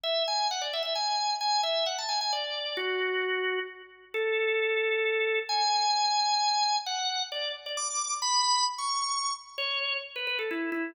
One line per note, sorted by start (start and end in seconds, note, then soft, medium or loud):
0.04 0.23 E5 medium
0.28 0.48 G#5 medium
0.51 0.62 F#5 medium
0.61 0.72 D5 medium
0.73 0.82 E5 medium
0.83 0.94 E5 medium
0.95 1.34 G#5 medium
1.41 1.61 G#5 medium
1.63 1.85 E5 medium
1.86 1.97 F#5 medium
1.98 2.09 A5 medium
2.09 2.19 G#5 medium
2.21 2.32 G#5 medium
2.33 2.76 D5 medium
2.77 3.59 F#4 medium
4.14 5.39 A4 medium
5.49 6.76 G#5 medium
6.86 7.23 F#5 medium
7.32 7.52 D5 medium
7.66 7.77 D5 medium
7.77 8.14 D6 medium
8.22 8.64 B5 loud
8.78 9.31 C#6 medium
9.58 9.97 C#5 medium
10.16 10.27 B4 medium
10.27 10.38 B4 medium
10.39 10.50 A4 medium
10.51 10.70 E4 medium
10.72 10.91 E4 medium